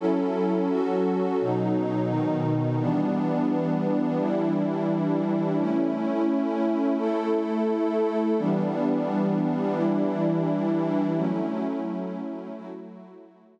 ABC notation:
X:1
M:4/4
L:1/8
Q:1/4=86
K:F#phr
V:1 name="Pad 5 (bowed)"
[F,CEA]2 [F,CFA]2 [B,,F,^D]2 [B,,^D,D]2 | [E,G,B,D]4 [E,G,DE]4 | [A,CE]4 [A,EA]4 | [E,G,B,D]4 [E,G,DE]4 |
[F,A,CE]4 [F,A,EF]4 |]